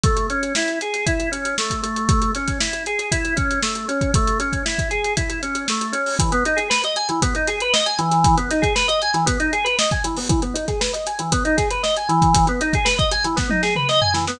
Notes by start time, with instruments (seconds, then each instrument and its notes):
0.04 drawbar organ A3, kick, closed hi-hat
0.17 closed hi-hat
0.30 drawbar organ C#4, closed hi-hat
0.43 closed hi-hat
0.55 drawbar organ E4, snare
0.68 closed hi-hat
0.81 drawbar organ G#4, closed hi-hat
0.94 snare, closed hi-hat
1.06 drawbar organ E4, kick, closed hi-hat
1.20 closed hi-hat
1.32 drawbar organ C#4, closed hi-hat
1.45 closed hi-hat
1.58 drawbar organ A3, snare
1.70 kick, closed hi-hat
1.83 drawbar organ A3, closed hi-hat
1.96 closed hi-hat
2.09 kick, closed hi-hat
2.22 closed hi-hat
2.35 drawbar organ C#4, snare, closed hi-hat
2.48 kick, snare, closed hi-hat
2.60 drawbar organ E4, snare
2.73 closed hi-hat
2.86 drawbar organ G#4, closed hi-hat
2.99 closed hi-hat
3.12 drawbar organ E4, kick, closed hi-hat
3.25 closed hi-hat
3.36 drawbar organ C#4, kick, closed hi-hat
3.51 closed hi-hat
3.63 drawbar organ A3, snare
3.75 closed hi-hat
3.88 drawbar organ C#4, closed hi-hat
4.01 kick, closed hi-hat
4.14 drawbar organ A3, kick, closed hi-hat
4.27 closed hi-hat
4.40 drawbar organ C#4, closed hi-hat
4.53 kick, closed hi-hat
4.65 drawbar organ E4, snare
4.79 kick, closed hi-hat
4.91 drawbar organ G#4, closed hi-hat
5.04 closed hi-hat
5.17 drawbar organ E4, kick, closed hi-hat
5.30 closed hi-hat
5.43 drawbar organ C#4, closed hi-hat
5.55 closed hi-hat
5.68 drawbar organ A3, snare
5.81 closed hi-hat
5.92 drawbar organ C#4, closed hi-hat
6.06 open hi-hat
6.19 drawbar organ E3, kick, closed hi-hat
6.32 drawbar organ B3, closed hi-hat
6.45 drawbar organ D#4, closed hi-hat
6.57 drawbar organ G#4, closed hi-hat
6.70 drawbar organ B4, snare
6.84 drawbar organ D#5, closed hi-hat
6.96 drawbar organ G#5, closed hi-hat
7.09 drawbar organ E3, closed hi-hat
7.22 drawbar organ B3, kick, closed hi-hat
7.35 drawbar organ D#4, closed hi-hat
7.47 drawbar organ G#4, snare, closed hi-hat
7.60 drawbar organ B4, closed hi-hat
7.73 drawbar organ D#5, snare
7.86 drawbar organ G#5, closed hi-hat
7.99 drawbar organ E3, closed hi-hat
8.11 snare, closed hi-hat
8.24 kick, closed hi-hat
8.37 drawbar organ B3, closed hi-hat
8.51 drawbar organ D#4, snare, closed hi-hat
8.62 drawbar organ G#4, kick, closed hi-hat
8.75 drawbar organ B4, snare
8.88 drawbar organ D#5, closed hi-hat
9.02 drawbar organ G#5, closed hi-hat
9.14 drawbar organ E3, snare, closed hi-hat
9.26 drawbar organ B3, kick, closed hi-hat
9.40 drawbar organ D#4, closed hi-hat
9.53 drawbar organ G#4, closed hi-hat
9.64 drawbar organ B4, snare, closed hi-hat
9.79 drawbar organ D#5, snare
9.91 drawbar organ G#5, kick, closed hi-hat
10.04 drawbar organ E3, closed hi-hat
10.17 drawbar organ B3, open hi-hat
10.29 drawbar organ E3, kick, closed hi-hat
10.42 drawbar organ B3, closed hi-hat
10.54 drawbar organ D#4, closed hi-hat
10.68 drawbar organ G#4, kick, snare, closed hi-hat
10.81 drawbar organ B4, snare
10.93 drawbar organ D#5, closed hi-hat
11.06 drawbar organ G#5, snare, closed hi-hat
11.19 drawbar organ E3, closed hi-hat
11.32 drawbar organ B3, kick, closed hi-hat
11.45 drawbar organ D#4, closed hi-hat
11.57 drawbar organ G#4, kick, snare, closed hi-hat
11.71 drawbar organ B4, closed hi-hat
11.83 drawbar organ D#5, snare
11.97 drawbar organ G#5, closed hi-hat
12.09 drawbar organ E3, closed hi-hat
12.22 kick, closed hi-hat
12.34 kick, closed hi-hat
12.47 drawbar organ B3, closed hi-hat
12.61 drawbar organ D#4, closed hi-hat
12.73 drawbar organ G#4, kick, closed hi-hat
12.85 drawbar organ B4, snare
12.98 drawbar organ D#5, kick, closed hi-hat
13.12 drawbar organ G#5, closed hi-hat
13.24 drawbar organ E3, closed hi-hat
13.36 drawbar organ B3, kick, snare
13.50 drawbar organ D#4, high tom
13.63 drawbar organ G#4, snare
13.76 drawbar organ B4, mid tom
13.89 drawbar organ D#5, snare
14.01 drawbar organ G#5, floor tom
14.14 drawbar organ E3, snare
14.27 drawbar organ B3, snare